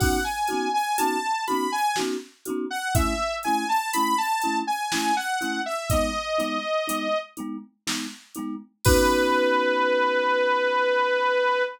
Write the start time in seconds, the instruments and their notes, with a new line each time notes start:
0.00 marimba B3 C#4 D#4 F#4, lead 2 (sawtooth) F#5, kick, crash
0.24 lead 2 (sawtooth) G#5
0.48 marimba C#4 D#4 F#4, closed hi-hat
0.53 marimba B3
0.74 lead 2 (sawtooth) G#5
0.98 marimba C#4 D#4 F#4, lead 2 (sawtooth) A5, closed hi-hat
1.02 marimba B3
1.47 marimba C#4 D#4 F#4, lead 2 (sawtooth) B5, closed hi-hat
1.52 marimba B3
1.72 lead 2 (sawtooth) G#5
1.96 marimba C#4 D#4 F#4, snare
2.01 marimba B3
2.45 marimba C#4 D#4 F#4, closed hi-hat
2.50 marimba B3
2.70 lead 2 (sawtooth) F#5
2.95 marimba A3 C#4 E4, lead 2 (sawtooth) E5, kick, closed hi-hat
3.43 marimba C#4 E4, lead 2 (sawtooth) G#5, closed hi-hat
3.48 marimba A3
3.69 lead 2 (sawtooth) A5
3.93 marimba C#4 E4, lead 2 (sawtooth) B5, closed hi-hat
3.98 marimba A3
4.18 lead 2 (sawtooth) A5
4.41 marimba C#4 E4, closed hi-hat
4.47 marimba A3
4.67 lead 2 (sawtooth) G#5
4.92 marimba A3 C#4 E4, lead 2 (sawtooth) G#5, snare
5.17 lead 2 (sawtooth) F#5
5.41 marimba A3 C#4 E4, closed hi-hat
5.66 lead 2 (sawtooth) E5
5.90 marimba B3 D#4, lead 2 (sawtooth) D#5, kick, closed hi-hat
5.94 marimba G#3
6.38 marimba G#3 B3 D#4, closed hi-hat
6.88 marimba G#3 B3 D#4, closed hi-hat
7.37 marimba G#3 B3 D#4, closed hi-hat
7.87 marimba G#3 B3 D#4, snare
8.35 marimba G#3 B3 D#4, closed hi-hat
8.85 marimba C#4 D#4 F#4, lead 2 (sawtooth) B4, kick, crash
8.90 marimba B3